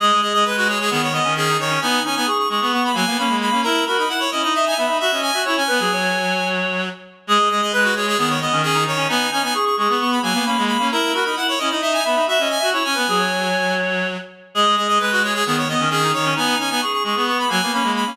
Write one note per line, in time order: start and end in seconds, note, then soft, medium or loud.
0.00 0.11 G#3 loud
0.00 0.20 G#4 medium
0.00 0.21 D#5 medium
0.12 0.22 G#3 medium
0.22 0.33 G#3 medium
0.22 0.43 G#4 medium
0.22 0.33 D#5 medium
0.34 0.45 G#3 medium
0.34 0.45 D#5 medium
0.45 0.89 G#3 medium
0.45 0.56 B4 medium
0.45 0.68 B4 medium
0.57 0.68 F#4 medium
0.68 0.79 G#4 medium
0.68 0.87 C#5 medium
0.80 0.90 G#4 medium
0.90 1.20 D#3 medium
0.90 1.09 B3 medium
0.90 1.02 G#4 medium
1.02 1.13 C#5 medium
1.13 1.24 B3 medium
1.13 1.34 D#5 medium
1.24 1.58 D#3 loud
1.24 1.35 C#4 medium
1.36 1.48 C#4 medium
1.36 1.57 G#4 medium
1.49 1.70 D#4 medium
1.58 1.78 D#3 medium
1.58 1.80 C#5 medium
1.70 1.80 C#4 medium
1.81 2.00 B3 loud
1.81 2.04 D#4 medium
1.81 2.02 G#5 medium
2.04 2.16 C#4 medium
2.04 2.26 D#4 medium
2.04 2.15 G#5 medium
2.15 2.27 B3 medium
2.15 2.26 G#5 medium
2.26 2.46 G#4 medium
2.26 2.38 C#6 medium
2.38 2.49 C#6 medium
2.49 2.60 G#3 medium
2.49 2.70 G#4 medium
2.49 2.60 C#6 medium
2.61 2.91 B3 medium
2.61 2.72 C#6 medium
2.73 2.92 B3 medium
2.73 2.84 C#6 medium
2.84 2.95 B5 medium
2.93 3.05 F#3 loud
2.93 3.04 A#3 medium
2.93 3.17 G#5 medium
3.06 3.17 A#3 medium
3.06 3.18 B3 medium
3.18 3.29 A#3 medium
3.18 3.29 C#4 medium
3.18 3.37 B5 medium
3.29 3.49 G#3 medium
3.29 3.50 A#3 medium
3.41 3.61 B5 medium
3.51 3.62 A#3 medium
3.51 3.64 C#4 medium
3.63 3.84 E4 loud
3.63 3.85 A#4 medium
3.63 3.85 A#5 medium
3.86 3.98 F#4 medium
3.86 4.05 A#4 medium
3.86 3.97 B5 medium
3.98 4.09 D#4 medium
3.98 4.09 B5 medium
4.09 4.27 E4 medium
4.09 4.20 F#5 medium
4.20 4.30 C#5 medium
4.31 4.43 C#4 medium
4.31 4.52 E4 medium
4.31 4.42 D#5 medium
4.43 4.74 D#4 loud
4.43 4.54 D#5 medium
4.54 4.65 D#5 medium
4.54 4.73 E5 medium
4.67 4.77 G#5 medium
4.77 4.88 B3 medium
4.77 4.86 E5 medium
4.77 4.98 B5 medium
4.86 4.99 D#4 medium
4.86 4.97 E5 medium
5.00 5.12 F#4 medium
5.00 5.21 E5 medium
5.00 5.11 E5 medium
5.11 5.31 C#4 medium
5.11 5.31 D#5 medium
5.22 5.42 G#5 medium
5.33 5.45 F#4 medium
5.33 5.44 E5 medium
5.45 5.57 E4 medium
5.45 5.63 C#5 medium
5.45 5.56 C#6 medium
5.57 5.68 C#4 loud
5.57 6.48 G#5 medium
5.67 5.80 B3 loud
5.67 5.78 B4 medium
5.79 6.89 F#3 medium
5.79 5.91 G#4 medium
5.92 6.81 C#5 medium
7.27 7.38 G#3 loud
7.27 7.49 G#4 medium
7.27 7.49 D#5 medium
7.39 7.49 G#3 medium
7.50 7.61 G#3 medium
7.50 7.72 G#4 medium
7.50 7.61 D#5 medium
7.62 7.72 G#3 medium
7.62 7.73 D#5 medium
7.72 8.16 G#3 medium
7.72 7.94 B4 medium
7.72 7.83 B4 medium
7.84 7.94 F#4 medium
7.95 8.06 G#4 medium
7.95 8.16 C#5 medium
8.07 8.18 G#4 medium
8.18 8.47 D#3 medium
8.18 8.37 B3 medium
8.18 8.29 G#4 medium
8.29 8.40 C#5 medium
8.41 8.52 B3 medium
8.41 8.62 D#5 medium
8.52 8.85 D#3 loud
8.52 8.63 C#4 medium
8.63 8.76 C#4 medium
8.63 8.84 G#4 medium
8.74 8.95 D#4 medium
8.86 9.06 D#3 medium
8.86 9.07 C#5 medium
8.97 9.08 C#4 medium
9.08 9.27 B3 loud
9.08 9.30 D#4 medium
9.08 9.30 G#5 medium
9.31 9.43 C#4 medium
9.31 9.53 D#4 medium
9.31 9.42 G#5 medium
9.43 9.53 B3 medium
9.43 9.54 G#5 medium
9.54 9.75 G#4 medium
9.54 9.65 C#6 medium
9.65 9.76 C#6 medium
9.77 9.87 G#3 medium
9.77 9.97 G#4 medium
9.77 9.89 C#6 medium
9.89 10.19 B3 medium
9.89 9.99 C#6 medium
10.00 10.20 B3 medium
10.00 10.11 C#6 medium
10.11 10.22 B5 medium
10.22 10.33 F#3 loud
10.22 10.33 A#3 medium
10.22 10.45 G#5 medium
10.33 10.45 A#3 medium
10.33 10.44 B3 medium
10.46 10.57 A#3 medium
10.46 10.56 C#4 medium
10.46 10.64 B5 medium
10.57 10.77 G#3 medium
10.57 10.78 A#3 medium
10.67 10.88 B5 medium
10.78 10.89 A#3 medium
10.78 10.90 C#4 medium
10.91 11.12 E4 loud
10.91 11.12 A#4 medium
10.91 11.13 A#5 medium
11.13 11.25 F#4 medium
11.13 11.32 A#4 medium
11.13 11.24 B5 medium
11.25 11.36 D#4 medium
11.25 11.35 B5 medium
11.36 11.55 E4 medium
11.36 11.47 F#5 medium
11.48 11.59 C#5 medium
11.58 11.71 C#4 medium
11.58 11.79 E4 medium
11.58 11.69 D#5 medium
11.70 12.02 D#4 loud
11.70 11.81 D#5 medium
11.81 11.93 D#5 medium
11.81 11.99 E5 medium
11.93 12.04 G#5 medium
12.04 12.16 B3 medium
12.04 12.15 E5 medium
12.04 12.25 B5 medium
12.15 12.27 D#4 medium
12.15 12.26 E5 medium
12.27 12.38 F#4 medium
12.27 12.48 E5 medium
12.27 12.40 E5 medium
12.39 12.58 C#4 medium
12.39 12.59 D#5 medium
12.50 12.70 G#5 medium
12.59 12.73 F#4 medium
12.59 12.70 E5 medium
12.72 12.83 E4 medium
12.72 12.92 C#5 medium
12.72 12.84 C#6 medium
12.84 12.95 C#4 loud
12.84 13.75 G#5 medium
12.94 13.07 B3 loud
12.94 13.05 B4 medium
13.07 14.17 F#3 medium
13.07 13.19 G#4 medium
13.19 14.07 C#5 medium
14.54 14.65 G#3 loud
14.54 14.75 G#4 medium
14.54 14.75 D#5 medium
14.65 14.76 G#3 medium
14.76 14.88 G#3 medium
14.76 14.98 G#4 medium
14.76 14.87 D#5 medium
14.88 14.98 G#3 medium
14.88 14.99 D#5 medium
14.99 15.43 G#3 medium
14.99 15.20 B4 medium
14.99 15.11 B4 medium
15.12 15.22 F#4 medium
15.23 15.33 G#4 medium
15.23 15.43 C#5 medium
15.34 15.45 G#4 medium
15.45 15.75 D#3 medium
15.45 15.65 B3 medium
15.45 15.56 G#4 medium
15.57 15.68 C#5 medium
15.68 15.81 B3 medium
15.68 15.89 D#5 medium
15.80 16.12 D#3 loud
15.80 15.89 C#4 medium
15.90 16.00 C#4 medium
15.90 16.11 G#4 medium
16.04 16.25 D#4 medium
16.13 16.34 D#3 medium
16.13 16.34 C#5 medium
16.25 16.36 C#4 medium
16.36 16.55 B3 loud
16.36 16.58 D#4 medium
16.36 16.58 G#5 medium
16.59 16.70 C#4 medium
16.59 16.81 D#4 medium
16.59 16.69 G#5 medium
16.70 16.81 B3 medium
16.70 16.81 G#5 medium
16.81 17.03 G#4 medium
16.81 16.92 C#6 medium
16.93 17.03 C#6 medium
17.04 17.15 G#3 medium
17.04 17.24 G#4 medium
17.04 17.16 C#6 medium
17.15 17.45 B3 medium
17.15 17.26 C#6 medium
17.27 17.48 B3 medium
17.27 17.38 C#6 medium
17.39 17.50 B5 medium
17.48 17.61 F#3 loud
17.48 17.58 A#3 medium
17.48 17.72 G#5 medium
17.62 17.72 A#3 medium
17.62 17.73 B3 medium
17.72 17.82 A#3 medium
17.72 17.83 C#4 medium
17.72 17.92 B5 medium
17.82 18.04 G#3 medium
17.82 18.03 A#3 medium
17.96 18.16 B5 medium
18.06 18.17 A#3 medium
18.06 18.17 C#4 medium